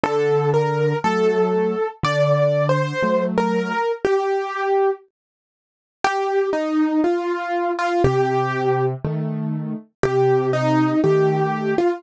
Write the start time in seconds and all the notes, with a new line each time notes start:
0.03 D3 A4
0.54 A#4
1.04 F#3 A3 A4
2.03 D3 D5
2.69 C5
3.02 F#3 A3
3.38 A#4
4.05 G4
6.04 G4
6.53 D#4
7.04 F4
7.79 F4
8.04 C3 G4
9.04 D#3 A3
10.03 C3 G4
10.53 D#4
11.04 D#3 A3 G4
11.78 F4